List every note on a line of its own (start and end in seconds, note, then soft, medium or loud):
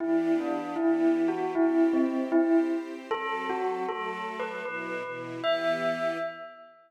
0.00 0.77 E3 medium
0.00 0.77 B3 medium
0.00 0.77 D4 medium
0.00 0.31 E4 medium
0.00 0.77 G4 medium
0.40 0.76 D4 medium
0.76 1.54 E3 medium
0.76 1.54 B3 medium
0.76 1.19 E4 medium
0.76 1.54 E4 medium
0.76 1.54 G4 medium
1.28 1.52 F#4 medium
1.55 2.32 C4 medium
1.55 2.32 E4 medium
1.55 1.88 E4 medium
1.55 2.32 G4 medium
1.93 2.29 C4 medium
2.32 3.09 C4 medium
2.32 2.57 E4 medium
2.32 3.09 G4 medium
2.32 3.09 C5 medium
3.10 3.86 F#3 medium
3.10 3.86 C4 medium
3.10 3.86 A4 medium
3.10 3.44 A4 loud
3.49 3.82 F#4 medium
3.87 4.64 F#3 medium
3.87 4.64 A3 medium
3.87 4.64 A4 medium
3.87 4.36 A4 medium
4.40 4.61 B4 medium
4.64 5.03 B2 medium
4.64 5.03 F#3 medium
4.64 5.03 E4 medium
4.64 5.10 B4 medium
5.03 5.42 B2 medium
5.03 5.41 E3 medium
5.03 5.42 E4 medium
5.42 6.18 E3 loud
5.42 6.18 B3 loud
5.42 6.18 G4 loud
5.42 6.19 E5 loud